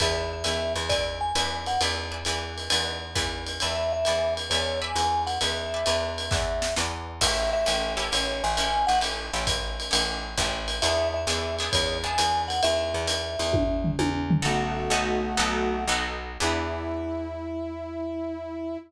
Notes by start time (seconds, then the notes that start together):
0.00 E2 B4 D5 E5 G#5, kick, ride
0.33 E5
0.44 E2 B4 D5 E5 G#5, hi-hat pedal, ride
0.76 E2, ride
0.89 B4 D5 E5 G#5, kick, ride
1.21 G#5
1.35 E2 B4 D5 E5 G#5, hi-hat pedal, ride
1.66 F#5, ride
1.81 E2 B4 D5 E5 G#5, ride
2.11 B4 D5 E5 G#5
2.25 E2 B4 D5 E5 G#5, hi-hat pedal, ride
2.58 ride
2.70 E2 B4 D5 E5 G#5, ride
3.15 E2 B4 D5 E5 G#5, kick, hi-hat pedal, ride
3.47 ride
3.60 E2 B4 D5 E5 G#5, ride
3.93 E5
4.05 E2 B4 D5 E5 G#5, hi-hat pedal, ride
4.37 ride
4.50 E2 B4 C#5 D5 E5 G#5, ride
4.81 B4 D5 E5 G#5
4.95 E2, hi-hat pedal, ride
5.27 F#5, ride
5.41 E2 B4 D5 E5 G#5, ride
5.74 B4 D5 E5 G#5
5.86 E2 B4 D5 E5 G#5, hi-hat pedal, ride
6.18 ride
6.31 E2 B4 D5 E5 G#5, kick, snare
6.62 snare
6.76 E2 B4 D5 E5 G#5, snare
7.21 A1 C#4 E4 G4 A4 E5, kick, crash, ride
7.53 E5
7.66 A1 C#4 E4 G4 A4, hi-hat pedal, ride
7.97 C#4 E4 G4 A4, ride
8.12 A1 C#5, ride
8.44 A1 G#5
8.57 C#4 E4 G4 A4, hi-hat pedal, ride
8.87 A1 F#5, ride
9.01 C#4 E4 G4 A4, ride
9.33 A1 C#4 E4 G4 A4
9.47 kick, hi-hat pedal, ride
9.80 ride
9.91 A1 C#4 E4 G4 A4, ride
10.38 A1 C#4 E4 G4 A4, kick, hi-hat pedal, ride
10.68 ride
10.82 E2 B3 D4 E4 G#4 E5, ride
11.14 E5
11.27 E2 B3 D4 E4 G#4, hi-hat pedal, ride
11.59 B3 D4 E4 G#4, ride
11.73 E2 C#5, kick, ride
12.03 B3 D4 E4 G#4 G#5
12.18 E2, hi-hat pedal, ride
12.48 F#5, ride
12.63 E2 E5, ride
12.94 E2
13.07 hi-hat pedal, ride
13.39 E2, ride
13.53 kick, high tom
13.84 floor tom
13.99 E2, high tom
14.31 floor tom
14.42 B1 A3 B3 D#4 F#4 A4
14.90 B1 B3 D#4 F#4 A4
15.37 B1 B3 D#4 F#4 A4
15.88 B1 B3 D#4 F#4 A4
16.40 E2 B3 D4 E4 G#4